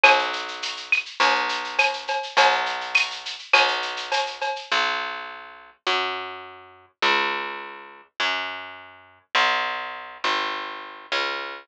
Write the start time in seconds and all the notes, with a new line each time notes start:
0.04 B1, cowbell, claves, shaker
0.19 shaker
0.33 shaker
0.48 shaker
0.62 tambourine, shaker
0.77 shaker
0.92 claves, shaker
1.06 shaker
1.20 B1, cowbell, shaker
1.35 shaker
1.49 shaker
1.64 shaker
1.79 tambourine, cowbell, claves, shaker
1.93 shaker
2.08 cowbell, shaker
2.23 shaker
2.37 B1, cowbell, shaker
2.52 shaker
2.66 shaker
2.81 shaker
2.95 tambourine, claves, shaker
3.11 shaker
3.25 shaker
3.39 shaker
3.53 B1, cowbell, claves, shaker
3.68 shaker
3.82 shaker
3.97 shaker
4.12 tambourine, cowbell, shaker
4.26 shaker
4.41 cowbell, shaker
4.56 shaker
4.72 B1
5.87 F#2
7.02 C#2
8.20 F#2
9.35 B1
10.24 G#1
11.12 C#2